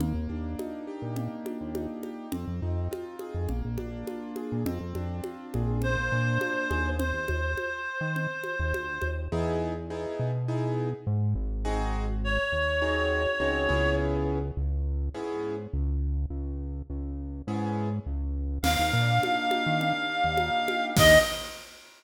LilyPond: <<
  \new Staff \with { instrumentName = "Clarinet" } { \time 4/4 \key ees \major \tempo 4 = 103 r1 | r1 | r2 c''2 | c''1 |
\key e \major r1 | r4 cis''2. | r1 | r1 |
\key ees \major f''1 | ees''4 r2. | }
  \new Staff \with { instrumentName = "Acoustic Grand Piano" } { \time 4/4 \key ees \major bes8 d'8 ees'8 g'8 bes8 d'8 ees'8 g'8 | c'8 ees'8 f'8 aes'8 bes8 d'8 f'8 aes'8 | c'8 d'8 f'8 aes'8 bes8 d'8 f'8 aes'8 | r1 |
\key e \major <b dis' e' gis'>4 <b dis' e' gis'>4 <b dis' e' gis'>2 | <bis dis' fis' gis'>2 <bis dis' fis' gis'>4 <bis dis' fis' gis'>8 <b cis' e' gis'>8~ | <b cis' e' gis'>2 <b cis' e' gis'>2~ | <b cis' e' gis'>2 <b cis' e' gis'>2 |
\key ees \major bes8 d'8 ees'8 g'8 bes8 d'8 ees'8 g'8 | <bes d' ees' g'>4 r2. | }
  \new Staff \with { instrumentName = "Synth Bass 1" } { \clef bass \time 4/4 \key ees \major ees,16 ees,16 ees,4~ ees,16 bes,4 ees,4~ ees,16 | f,16 f,16 f,4~ f,16 f,16 bes,,16 bes,,16 bes,,4~ bes,,16 bes,16 | f,16 f,16 f,4 bes,,8. bes,,16 bes,4 ees,8~ | ees,16 ees,16 ees,4~ ees,16 ees4 ees,16 d,8 ees,8 |
\key e \major e,4. b,4. gis,8 gis,,8~ | gis,,4. dis,4. cis,8 cis,8~ | cis,4 cis,4 gis,4 cis,4 | cis,4 cis,4 gis,4 cis,4 |
\key ees \major ees,16 ees,16 bes,4~ bes,16 ees4 ees,4~ ees,16 | ees,4 r2. | }
  \new DrumStaff \with { instrumentName = "Drums" } \drummode { \time 4/4 cgl4 cgho4 cgl8 cgho8 cgho8 cgho8 | cgl4 cgho8 cgho8 cgl8 cgho8 cgho8 cgho8 | cgl8 cgho8 cgho8 cgho8 cgl4 cgho8 cgho8 | cgl8 cgho8 cgho4 cgl8 cgho8 cgho8 cgho8 |
r4 r4 r4 r4 | r4 r4 r4 r4 | r4 r4 r4 r4 | r4 r4 r4 r4 |
<cgl cymc>4 cgho8 cgho8 cgl4 cgho8 cgho8 | <cymc bd>4 r4 r4 r4 | }
>>